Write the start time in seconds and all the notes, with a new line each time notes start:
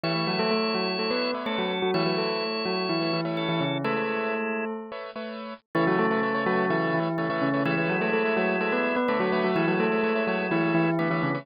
0.04 E3 A3 E4 B4 C#5 E5
0.15 A3 B4 C#5 E5
0.27 F#3 F#4
0.39 A3 A4
0.51 A3 A4
0.75 F#3 F#4
0.99 A3 A4
1.11 A3 B3 B4 C#5 E5
1.34 A3 B3 B4 C#5 E5
1.46 A3 C#4 A4
1.58 F#3 F#4
1.82 F#3 F#4
1.94 E3 A3 E4 B4 C#5 E5
2.06 F#3 A3 F#4 B4 C#5 E5
2.18 A3 A4
2.65 F#3 F#4
2.89 E3 E4
3.01 A3 B4 C#5 E5
3.13 E3 E4
3.25 A3 B4 C#5 E5
3.37 C#4 A4
3.49 E3 E4
3.61 C#3 C#4
3.84 G#3 A3 E4 A4 B4 C#5 E5
3.96 A3 B4 C#5 E5
4.92 A3 B4 C#5 E5
5.16 A3 B4 C#5 E5
5.75 C#3 E3 A3 E4 B4 C#5 E5
5.87 F#3 A3 F#4 B4 C#5 E5
5.99 A3 A4
6.11 A3 B4 C#5 E5
6.23 A3 B4 C#5 E5
6.35 A3 B4 C#5 E5
6.46 F#3 A3 F#4 B4 C#5 E5
6.70 E3 A3 E4 B4 C#5 E5
6.94 E3 E4
7.18 C#3 A3 B4 C#5 E5
7.30 E3 A3 E4 B4 C#5 E5
7.42 C#3 C#4
7.54 A3 B4 C#5 E5
7.65 E3 G#3 A3 E4 B4 C#5 E5
7.77 A3 B4 C#5 E5
7.89 F#3 F#4
8.01 A3 A4 B4 C#5 E5
8.13 A3 A4 B4 C#5 E5
8.25 A3 B4 C#5 E5
8.37 F#3 A3 F#4 B4 C#5 E5
8.61 A3 A4 B4 C#5 E5
8.72 B3 B4
8.96 B3 B4
9.08 D3 A3 B3 A4 B4 C#5 E5
9.20 F#3 A3 F#4 B4 C#5 E5
9.32 A3 B4 C#5 E5
9.44 F#3 F#4
9.56 E3 G#3 E4
9.68 F#3 A3 F#4 B4 C#5 E5
9.80 A3 A4
9.92 A3 B4 C#5 E5
10.03 A3 B4 C#5 E5
10.15 A3 B4 C#5 E5
10.27 F#3 A3 F#4 B4 C#5 E5
10.51 E3 A3 E4 B4 C#5 E5
10.75 E3 E4
10.99 D3 A3 B3 B4 C#5 E5
11.10 E3 A3 E4 B4 C#5 E5
11.23 C#3 C#4
11.35 A3 B4 C#5 E5